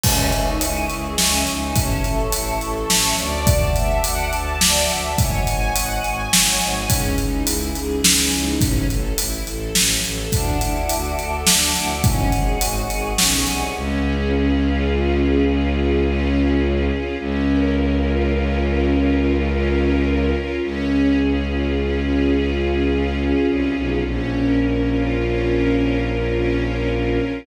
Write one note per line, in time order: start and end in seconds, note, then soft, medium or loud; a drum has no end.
0.04 0.29 C#2 medium
0.04 0.30 C#4 loud
0.04 1.74 C#5 medium
0.04 1.74 D#5 medium
0.04 1.74 E5 medium
0.04 1.74 G#5 medium
0.04 kick medium
0.04 crash loud
0.32 0.56 C#2 medium
0.32 0.58 D#4 medium
0.32 closed hi-hat medium
0.61 0.85 C#2 medium
0.61 0.87 E4 medium
0.61 closed hi-hat loud
0.90 1.14 C#2 medium
0.90 1.16 G#4 medium
0.90 closed hi-hat medium
1.18 1.43 C#2 medium
1.18 1.44 C#4 medium
1.18 snare medium
1.47 1.72 C#2 medium
1.47 1.73 D#4 medium
1.47 closed hi-hat medium
1.75 2.00 A1 medium
1.75 2.01 C#4 medium
1.75 3.45 C#5 loud
1.75 3.45 E5 medium
1.75 3.45 A5 medium
1.75 kick medium
1.75 closed hi-hat medium
2.04 2.28 A1 medium
2.04 2.30 A4 medium
2.04 closed hi-hat medium
2.32 2.57 A1 medium
2.32 2.59 E4 medium
2.32 closed hi-hat loud
2.61 2.85 A1 medium
2.61 2.87 A4 medium
2.61 closed hi-hat medium
2.90 3.14 A1 medium
2.90 3.15 C#4 medium
2.90 snare medium
3.18 3.71 D2 medium
3.18 3.73 D5 medium
3.18 closed hi-hat medium
3.47 5.17 D5 loud
3.47 5.17 E5 medium
3.47 5.17 F#5 medium
3.47 5.17 A5 loud
3.47 kick loud
3.47 closed hi-hat loud
3.75 3.99 D2 medium
3.75 4.01 E5 medium
3.75 closed hi-hat medium
4.04 4.29 D2 medium
4.04 4.30 F#5 medium
4.04 closed hi-hat loud
4.33 4.57 D2 medium
4.33 4.59 A5 medium
4.33 closed hi-hat medium
4.61 4.85 D2 medium
4.61 4.87 D5 medium
4.61 snare loud
4.90 5.14 D2 medium
4.90 5.15 E5 medium
4.90 closed hi-hat medium
5.18 5.43 G#1 medium
5.18 5.44 C#5 medium
5.18 6.88 C#5 medium
5.18 6.88 D#5 medium
5.18 6.88 F#5 medium
5.18 6.88 G#5 loud
5.18 kick loud
5.18 closed hi-hat medium
5.47 5.71 G#1 medium
5.47 5.73 G#5 medium
5.47 closed hi-hat medium
5.75 6.00 G#1 medium
5.75 6.01 F#5 medium
5.75 closed hi-hat loud
6.04 6.28 G#1 medium
6.04 6.30 G#5 medium
6.04 closed hi-hat medium
6.32 6.57 G#1 medium
6.32 6.58 C#5 medium
6.32 snare loud
6.61 6.86 G#1 medium
6.61 6.87 G#5 medium
6.61 closed hi-hat medium
6.89 7.14 C#2 medium
6.89 7.15 C#4 loud
6.89 8.60 C#4 loud
6.89 8.60 D#4 medium
6.89 8.60 E4 loud
6.89 8.60 G#4 medium
6.89 kick medium
6.89 closed hi-hat loud
7.18 7.43 C#2 medium
7.18 7.44 D#4 medium
7.18 closed hi-hat medium
7.47 7.71 C#2 medium
7.47 7.73 E4 medium
7.47 closed hi-hat loud
7.75 8.00 C#2 medium
7.75 8.01 G#4 medium
7.75 closed hi-hat medium
8.04 8.28 C#2 medium
8.04 8.30 C#4 medium
8.04 snare loud
8.32 8.57 C#2 medium
8.32 8.59 D#4 medium
8.32 closed hi-hat medium
8.61 8.85 A1 medium
8.61 8.87 C#4 medium
8.61 kick loud
8.61 closed hi-hat medium
8.89 9.14 A1 medium
8.89 9.15 A4 medium
8.89 closed hi-hat medium
9.18 9.43 A1 medium
9.18 9.44 E4 medium
9.18 closed hi-hat loud
9.47 9.71 A1 medium
9.47 9.73 A4 medium
9.47 closed hi-hat medium
9.75 10.00 A1 medium
9.75 10.01 C#4 medium
9.75 snare medium
10.04 10.28 A1 medium
10.04 10.29 A4 medium
10.04 closed hi-hat medium
10.32 10.57 D2 medium
10.32 10.58 D4 medium
10.32 12.02 D5 medium
10.32 12.02 E5 medium
10.32 12.02 F#5 medium
10.32 12.02 A5 medium
10.32 kick medium
10.32 closed hi-hat medium
10.61 10.86 D2 medium
10.61 10.87 E4 medium
10.61 closed hi-hat medium
10.89 11.15 D2 medium
10.89 11.16 F#4 medium
10.89 closed hi-hat medium
11.18 11.43 D2 medium
11.18 11.44 A4 medium
11.18 closed hi-hat medium
11.47 11.71 D2 medium
11.47 11.73 D4 medium
11.47 snare loud
11.75 12.00 D2 medium
11.75 12.01 E4 medium
11.75 closed hi-hat medium
12.04 12.29 G#1 medium
12.04 12.30 C#4 medium
12.04 13.74 C#5 medium
12.04 13.74 D#5 medium
12.04 13.74 F#5 medium
12.04 13.74 G#5 medium
12.04 kick loud
12.04 closed hi-hat medium
12.32 12.56 G#1 medium
12.32 12.58 G#4 medium
12.32 closed hi-hat medium
12.61 12.85 G#1 medium
12.61 12.87 F#4 medium
12.61 closed hi-hat loud
12.89 13.13 G#1 medium
12.89 13.16 G#4 medium
12.89 closed hi-hat medium
13.18 13.44 B1 medium
13.18 13.44 C#4 medium
13.18 snare medium
13.47 13.73 C2 medium
13.47 13.72 G#4 medium
13.47 closed hi-hat medium
13.75 16.91 C#2 loud
13.75 14.32 C#4 loud
14.04 15.18 G#4 medium
14.33 14.89 C#4 medium
14.61 15.46 F4 medium
14.90 15.75 C#4 medium
15.19 16.33 G#4 medium
15.46 16.90 F4 medium
15.75 16.04 C#4 medium
16.04 16.61 C#4 loud
16.33 17.14 G#4 medium
16.61 17.16 C#4 medium
16.90 17.17 F4 medium
17.18 20.33 C#2 loud
17.18 17.75 C#4 loud
17.47 18.61 A#4 medium
17.75 18.32 C#4 medium
18.04 18.89 F4 medium
18.32 19.18 C#4 medium
18.61 19.75 A#4 medium
18.90 20.32 F4 medium
19.18 19.46 C#4 medium
19.47 20.04 C#4 medium
19.76 20.57 A#4 medium
20.04 20.59 C#4 medium
20.33 20.60 F4 medium
20.61 23.33 C#2 medium
20.61 21.18 C#4 loud
20.90 22.03 G#4 medium
21.18 21.75 C#4 medium
21.47 22.32 F4 medium
21.76 22.61 C#4 medium
22.04 23.18 G#4 medium
22.33 23.75 F4 medium
22.61 22.89 C#4 medium
22.90 23.47 C#4 medium
23.18 24.00 G#4 medium
23.47 23.73 C2 medium
23.47 24.02 C#4 medium
23.75 24.02 B1 medium
23.75 24.03 F4 medium
24.04 27.19 A#1 medium
24.04 24.61 C#4 loud
24.33 25.46 A#4 medium
24.61 25.18 C#4 medium
24.90 25.75 F4 medium
25.18 26.03 C#4 medium
25.47 26.60 A#4 medium
25.75 27.18 F4 medium
26.04 26.32 C#4 medium
26.33 26.90 C#4 loud
26.61 27.42 A#4 medium
26.90 27.44 C#4 medium
27.18 27.45 F4 medium